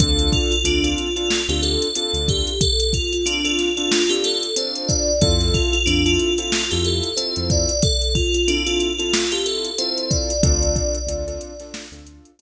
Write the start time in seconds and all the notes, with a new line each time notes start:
0.00 D2 C4 D4 F4 A4, kick, closed hi-hat
0.19 closed hi-hat
0.32 F4, kick, closed hi-hat
0.51 F4, closed hi-hat
0.64 D2 C4 D4 F4 A4, closed hi-hat
0.84 C4 D4 F4 A4, closed hi-hat
0.98 closed hi-hat
1.16 C4 D4 F4 A4, closed hi-hat
1.30 snare
1.49 D2 C4 D4 F4 G4 A4, closed hi-hat
1.62 A4, closed hi-hat
1.82 closed hi-hat
1.95 C4 D4 F4 A4, closed hi-hat
2.13 D2, closed hi-hat
2.28 G4, kick, closed hi-hat
2.47 closed hi-hat
2.61 A4, kick, closed hi-hat
2.80 closed hi-hat
2.93 F4, kick, closed hi-hat
3.13 F4, closed hi-hat
3.26 C4 D4 F4 A4, closed hi-hat
3.44 C4 D4 F4 A4, closed hi-hat
3.58 snare, closed hi-hat
3.77 C4 D4 F4 A4, closed hi-hat
3.92 snare
4.09 C4 D4 F4 G4 A4, closed hi-hat
4.24 A4, snare, closed hi-hat
4.43 closed hi-hat
4.56 C4 D4 F4 A4 C5, closed hi-hat
4.75 closed hi-hat
4.88 D5, kick, closed hi-hat
5.21 F2 C4 E4 F4 A4, kick, closed hi-hat
5.40 snare, closed hi-hat
5.54 F4, kick, closed hi-hat
5.73 F4, closed hi-hat
5.86 F2 C4 D4 E4 F4 A4, closed hi-hat
6.06 C4 E4 F4 A4, closed hi-hat
6.19 closed hi-hat
6.38 C4 E4 F4 A4, closed hi-hat
6.52 snare
6.71 F2 C4 E4 F4 G4 A4, closed hi-hat
6.85 A4, closed hi-hat
7.03 closed hi-hat
7.17 C4 E4 F4 A4 C5, closed hi-hat
7.36 F2, closed hi-hat
7.50 D5, kick, closed hi-hat
7.69 closed hi-hat
7.82 A4, kick, closed hi-hat
8.02 closed hi-hat
8.15 F4, kick, closed hi-hat
8.34 F4, closed hi-hat
8.48 C4 D4 E4 F4 A4, closed hi-hat
8.66 C4 E4 F4 A4, closed hi-hat
8.80 closed hi-hat
8.98 C4 E4 F4 A4, closed hi-hat
9.13 snare
9.32 C4 E4 F4 G4 A4, closed hi-hat
9.46 A4, closed hi-hat
9.65 closed hi-hat
9.78 C4 E4 F4 A4 C5, closed hi-hat
9.98 closed hi-hat
10.11 D5, kick, closed hi-hat
10.30 closed hi-hat
10.43 D2 C4 D4 F4 A4 D5, kick, closed hi-hat
10.62 closed hi-hat
10.76 kick, closed hi-hat
10.94 closed hi-hat
11.07 D2 C4 D4 F4 A4, closed hi-hat
11.27 C4 D4 F4 A4, closed hi-hat
11.41 closed hi-hat
11.60 C4 D4 F4 A4, snare, closed hi-hat
11.74 snare
11.92 D2 C4 D4 F4 A4, closed hi-hat
12.07 closed hi-hat
12.25 closed hi-hat
12.39 C4 D4 F4 A4, closed hi-hat